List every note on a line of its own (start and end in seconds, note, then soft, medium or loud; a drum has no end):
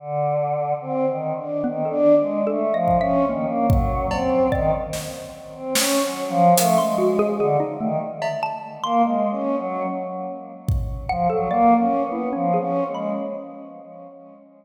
0.00 0.74 D3 medium
0.81 1.06 C4 medium
1.08 1.33 D#3 medium
1.37 1.62 D4 medium
1.64 1.89 D#3 medium
1.64 1.82 B3 medium
1.85 2.41 A4 medium
1.90 2.15 D4 loud
2.19 2.44 G#3 medium
2.47 2.72 A3 medium
2.47 2.72 A4 medium
2.73 2.98 F3 medium
2.73 2.99 D#5 medium
2.88 kick medium
3.01 3.25 C#4 loud
3.01 3.26 E5 medium
3.28 3.46 D#3 medium
3.28 4.40 A#3 medium
3.48 3.66 A#3 medium
3.69 4.06 F#3 medium
3.69 kick loud
4.11 4.48 C4 medium
4.11 cowbell loud
4.52 4.71 D#3 medium
4.52 5.63 D5 loud
4.52 kick medium
4.93 snare medium
5.55 5.74 C4 medium
5.75 6.02 C#4 loud
5.75 snare loud
6.04 6.29 F#3 medium
6.29 6.54 F3 loud
6.58 6.77 A3 medium
6.58 6.76 A#4 medium
6.58 closed hi-hat loud
6.78 7.34 G#3 medium
6.78 6.97 C6 medium
6.98 7.17 F#4 loud
7.19 7.38 G#4 loud
7.38 7.57 D3 medium
7.38 7.59 G#4 loud
7.60 7.78 D#4 medium
7.79 7.98 D#3 medium
7.79 7.99 A3 loud
8.22 8.40 E5 medium
8.22 cowbell loud
8.43 8.80 A5 loud
8.84 9.02 A#3 loud
8.84 9.58 C6 loud
9.03 9.28 G#3 medium
9.31 9.56 C#4 medium
9.58 9.83 F#3 medium
10.68 kick loud
11.09 11.28 F3 medium
11.09 11.28 F#5 loud
11.30 11.48 F#3 medium
11.30 11.48 A4 loud
11.49 11.74 A#3 loud
11.49 12.06 D5 medium
11.78 12.03 C#4 medium
12.04 12.29 B3 medium
12.12 12.30 E4 medium
12.33 12.57 F3 medium
12.33 12.51 C#4 medium
12.54 12.91 G#4 medium
12.59 12.84 C#4 medium
12.88 13.13 G#3 medium
12.95 13.13 B5 soft